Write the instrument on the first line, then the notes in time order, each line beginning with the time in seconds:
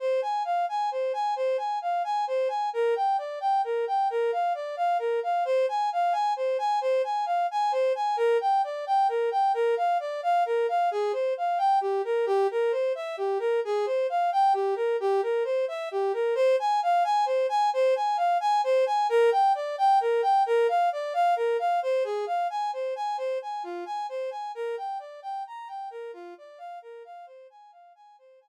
brass section
0.00 C5
0.22 G#5
0.45 F5
0.69 G#5
0.91 C5
1.13 G#5
1.36 C5
1.58 G#5
1.82 F5
2.04 G#5
2.27 C5
2.49 G#5
2.73 A#4
2.96 G5
3.18 D5
3.41 G5
3.64 A#4
3.87 G5
4.10 A#4
4.32 F5
4.55 D5
4.77 F5
4.99 A#4
5.23 F5
5.45 C5
5.69 G#5
5.92 F5
6.12 G#5
6.36 C5
6.59 G#5
6.81 C5
7.04 G#5
7.26 F5
7.51 G#5
7.72 C5
7.95 G#5
8.17 A#4
8.41 G5
8.64 D5
8.87 G5
9.09 A#4
9.31 G5
9.54 A#4
9.77 F5
10.00 D5
10.23 F5
10.46 A#4
10.69 F5
10.91 G#4
11.13 C5
11.37 F5
11.58 G5
11.81 G4
12.05 A#4
12.26 G4
12.51 A#4
12.72 C5
12.95 E5
13.17 G4
13.39 A#4
13.65 G#4
13.86 C5
14.10 F5
14.32 G5
14.54 G4
14.76 A#4
15.00 G4
15.23 A#4
15.44 C5
15.68 E5
15.91 G4
16.13 A#4
16.35 C5
16.60 G#5
16.83 F5
17.04 G#5
17.26 C5
17.49 G#5
17.73 C5
17.96 G#5
18.17 F5
18.40 G#5
18.64 C5
18.86 G#5
19.09 A#4
19.32 G5
19.55 D5
19.78 G5
20.01 A#4
20.22 G5
20.46 A#4
20.69 F5
20.92 D5
21.14 F5
21.36 A#4
21.59 F5
21.82 C5
22.04 G#4
22.27 F5
22.50 G#5
22.73 C5
22.96 G#5
23.18 C5
23.42 G#5
23.63 F4
23.86 G#5
24.09 C5
24.31 G#5
24.55 A#4
24.77 G5
24.99 D5
25.22 G5
25.47 A#5
25.68 G5
25.91 A#4
26.13 F4
26.38 D5
26.58 F5
26.82 A#4
27.05 F5
27.26 C5
27.50 G#5
27.72 F5
27.95 G#5
28.18 C5
28.41 G#5